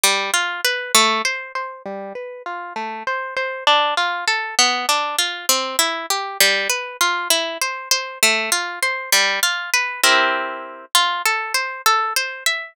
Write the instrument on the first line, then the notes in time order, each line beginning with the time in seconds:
orchestral harp
0.03 G3
0.34 F4
0.65 B4
0.95 A3
1.25 C5
1.55 C5
1.86 G3
2.15 B4
2.46 F4
2.76 A3
3.07 C5
3.36 C5
3.67 D4
3.97 F4
4.28 A4
4.59 B3
4.89 D4
5.18 F4
5.49 C4
5.79 E4
6.10 G4
6.40 G3
6.69 B4
7.01 F4
7.30 E4
7.61 C5
7.91 C5
8.23 A3
8.52 F4
8.82 C5
9.12 G3
9.43 F4
9.73 B4
10.04 C4 E4 G4 A#4
10.95 F4
11.26 A4
11.54 C5
11.86 A4
12.16 C5
12.46 E5